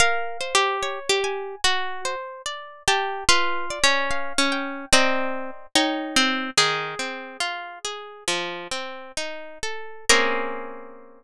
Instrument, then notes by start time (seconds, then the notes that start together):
acoustic guitar (steel)
0.00 A#4 F5
0.41 C5
0.55 G4
0.83 C#5
1.09 G4
1.24 G#5
1.64 F#4
2.05 C5
2.46 D5
2.88 G4 A5
3.29 F4 B4
3.70 D5
3.84 C#4
4.11 F5
4.38 C#4
4.52 G5
4.93 C4 D5 D#5 A#5
5.76 D#4 C#5 G5 A#5
6.16 C4
6.58 D#3 G#4
6.99 C4
7.40 F4
7.85 G#4
8.28 F3
8.71 C4
9.17 D#4
9.63 A4
10.09 A#3 C4 C#4 G#4 A#4